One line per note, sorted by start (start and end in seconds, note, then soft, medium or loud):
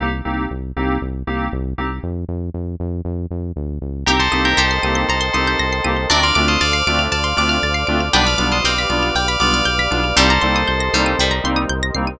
0.00 0.22 C2 medium
0.00 0.09 A#3 medium
0.00 0.09 C4 medium
0.00 0.09 D#4 loud
0.00 0.09 G4 loud
0.25 0.47 C2 medium
0.25 0.43 A#3 medium
0.25 0.43 C4 medium
0.25 0.43 D#4 medium
0.25 0.43 G4 medium
0.51 0.72 C2 medium
0.76 0.98 C2 medium
0.76 0.94 A#3 medium
0.76 0.94 C4 medium
0.76 0.94 D#4 medium
0.76 0.94 G4 medium
1.02 1.23 C2 medium
1.27 1.49 C2 medium
1.27 1.45 A#3 medium
1.27 1.45 C4 medium
1.27 1.45 D#4 medium
1.27 1.45 G4 medium
1.52 1.74 C2 medium
1.78 2.00 C2 medium
1.78 1.87 A#3 medium
1.78 1.87 C4 medium
1.78 1.87 D#4 medium
1.78 1.87 G4 medium
2.03 2.25 F2 medium
2.28 2.50 F2 medium
2.54 2.76 F2 medium
2.80 3.01 F2 medium
3.05 3.26 F2 medium
3.31 3.52 F2 medium
3.56 3.79 D2 medium
3.81 4.04 C#2 medium
4.06 4.28 C2 medium
4.06 4.16 A#3 medium
4.06 4.16 C4 medium
4.06 4.16 D#4 medium
4.06 4.19 G4 medium
4.06 4.16 G4 medium
4.06 4.56 G4 medium
4.06 4.19 A#4 medium
4.06 6.08 A#4 medium
4.06 6.08 C5 medium
4.06 6.08 D#5 medium
4.06 6.08 G5 medium
4.06 4.19 A#5 loud
4.19 4.41 A4 medium
4.19 4.41 C5 medium
4.19 4.31 C6 medium
4.32 4.54 C2 medium
4.32 4.50 A#3 medium
4.32 4.50 C4 medium
4.32 4.50 D#4 medium
4.32 4.50 G4 medium
4.32 4.43 D#6 medium
4.45 4.57 G4 medium
4.45 4.57 A#4 medium
4.45 4.57 G6 medium
4.57 4.79 C2 medium
4.57 5.55 G4 medium
4.57 5.07 A4 medium
4.57 5.07 C5 medium
4.57 4.69 A#6 medium
4.71 4.82 C7 medium
4.83 5.05 C2 medium
4.83 5.02 A#3 medium
4.83 5.02 C4 medium
4.83 5.02 D#4 medium
4.83 5.02 G4 medium
4.83 4.95 D#7 medium
4.95 5.07 G7 medium
5.08 5.30 C2 medium
5.08 5.33 A4 medium
5.08 5.33 C5 medium
5.08 5.21 A#5 medium
5.21 5.32 C6 medium
5.33 5.56 C2 medium
5.33 5.52 A#3 medium
5.33 5.52 C4 medium
5.33 5.52 D#4 medium
5.33 5.52 G4 medium
5.33 6.06 A4 medium
5.33 6.06 C5 medium
5.33 5.46 D#6 medium
5.47 5.59 G6 medium
5.59 5.81 C2 medium
5.59 5.71 A#6 medium
5.73 5.84 C7 medium
5.84 6.06 C2 medium
5.84 5.93 A#3 medium
5.84 5.93 C4 medium
5.84 5.93 D#4 medium
5.84 5.93 G4 medium
5.84 5.96 D#7 medium
5.97 6.08 G7 medium
6.10 6.32 D2 medium
6.10 6.19 A3 loud
6.10 6.19 C4 loud
6.10 6.19 D4 medium
6.10 7.86 D4 medium
6.10 6.19 F4 medium
6.10 8.12 A4 medium
6.10 6.22 A#4 medium
6.10 8.12 C5 medium
6.10 6.22 D5 medium
6.10 8.12 D5 medium
6.10 8.12 F5 medium
6.10 6.21 A5 medium
6.23 6.45 D5 medium
6.23 6.45 F5 medium
6.23 6.35 C6 medium
6.35 6.57 D2 medium
6.35 6.54 A3 medium
6.35 6.54 C4 medium
6.35 6.54 D4 medium
6.35 6.54 F4 medium
6.35 6.47 D6 medium
6.48 6.60 C5 medium
6.48 6.60 D#5 medium
6.48 6.59 F6 medium
6.61 6.83 D2 medium
6.61 7.02 D5 medium
6.61 7.02 F5 medium
6.61 6.72 A6 medium
6.73 6.85 C7 medium
6.87 7.08 D2 medium
6.87 7.05 A3 medium
6.87 7.05 C4 medium
6.87 7.05 D4 medium
6.87 7.05 F4 medium
6.87 6.99 D7 medium
6.99 7.10 F7 medium
7.12 7.34 D2 medium
7.12 7.36 D5 medium
7.12 7.36 F5 medium
7.12 7.23 A5 medium
7.24 7.35 C6 medium
7.37 7.59 D2 medium
7.37 7.54 A3 medium
7.37 7.54 C4 medium
7.37 7.54 D4 medium
7.37 7.54 F4 medium
7.37 8.08 D5 medium
7.37 8.08 F5 medium
7.37 7.50 D6 medium
7.49 7.61 F6 medium
7.63 7.84 D2 medium
7.63 7.75 A6 medium
7.74 7.86 C7 medium
7.87 8.10 D2 medium
7.87 7.97 A3 medium
7.87 7.97 C4 medium
7.87 7.97 D4 medium
7.87 7.97 F4 medium
7.87 7.99 D7 medium
8.00 8.12 F7 medium
8.13 8.35 B1 loud
8.13 8.22 G3 loud
8.13 8.22 B3 medium
8.13 8.57 D4 medium
8.13 8.22 D4 loud
8.13 8.22 F4 medium
8.13 10.15 G4 medium
8.13 10.15 B4 medium
8.13 8.26 B4 medium
8.13 10.15 D5 medium
8.13 8.26 D5 medium
8.13 10.15 F5 medium
8.13 8.25 G5 loud
8.27 8.48 D5 medium
8.27 8.48 F5 medium
8.27 8.38 B5 medium
8.38 8.61 B1 medium
8.38 8.56 G3 medium
8.38 8.56 B3 medium
8.38 8.56 D4 medium
8.38 8.56 F4 medium
8.38 8.50 D6 medium
8.52 8.64 C5 medium
8.52 8.64 D#5 medium
8.52 8.63 F6 medium
8.64 8.86 B1 medium
8.64 9.57 C4 medium
8.64 9.14 D5 medium
8.64 9.14 F5 medium
8.64 8.77 G6 medium
8.78 8.90 B6 medium
8.90 9.11 B1 medium
8.90 9.07 G3 medium
8.90 9.07 B3 medium
8.90 9.07 D4 medium
8.90 9.07 F4 medium
8.90 9.01 D7 medium
9.03 9.14 F7 medium
9.15 9.37 B1 medium
9.15 9.39 D5 medium
9.15 9.39 F5 medium
9.15 9.27 G5 medium
9.28 9.40 B5 medium
9.40 9.62 B1 medium
9.40 9.58 G3 medium
9.40 9.58 B3 medium
9.40 9.58 D4 medium
9.40 9.58 F4 medium
9.40 10.15 D5 medium
9.40 10.15 F5 medium
9.40 9.51 D6 medium
9.54 9.65 F6 medium
9.65 9.88 B1 medium
9.65 9.77 G6 medium
9.79 9.91 B6 medium
9.91 10.13 B1 medium
9.91 10.00 G3 medium
9.91 10.00 B3 medium
9.91 10.00 D4 medium
9.91 10.00 F4 medium
9.91 10.03 D7 medium
10.04 10.16 F7 medium
10.16 10.38 C2 loud
10.16 10.25 G3 loud
10.16 10.85 G3 medium
10.16 10.25 A#3 loud
10.16 10.25 C4 loud
10.16 10.25 D#4 loud
10.16 12.18 G4 medium
10.16 11.25 A4 medium
10.16 12.18 A#4 medium
10.16 12.18 C5 medium
10.16 11.25 C5 medium
10.16 12.18 D#5 medium
10.16 10.29 G5 medium
10.30 10.42 A#5 medium
10.41 10.64 C2 medium
10.41 10.60 G3 medium
10.41 10.60 A#3 medium
10.41 10.60 C4 medium
10.41 10.60 D#4 medium
10.41 10.53 C6 medium
10.56 10.67 D#6 medium
10.68 10.90 C2 medium
10.68 10.79 G6 medium
10.80 10.92 A#6 medium
10.93 11.15 C2 medium
10.93 11.16 G3 medium
10.93 11.12 G3 medium
10.93 11.12 A#3 medium
10.93 11.12 C4 medium
10.93 11.12 D#4 medium
10.93 11.05 C7 medium
11.06 11.17 D#7 medium
11.19 11.40 C2 medium
11.19 11.64 G3 medium
11.19 11.31 G5 medium
11.31 11.42 A#5 medium
11.44 11.66 C2 medium
11.44 11.62 G3 medium
11.44 11.62 A#3 medium
11.44 11.62 C4 medium
11.44 11.62 D#4 medium
11.44 11.56 C6 medium
11.56 11.68 D#6 medium
11.69 11.91 C2 medium
11.69 11.81 G6 medium
11.83 11.94 A#6 medium
11.95 12.16 C2 medium
11.95 12.05 G3 medium
11.95 12.05 A#3 medium
11.95 12.05 C4 medium
11.95 12.05 D#4 medium
11.95 12.06 C7 medium
12.07 12.19 D#7 medium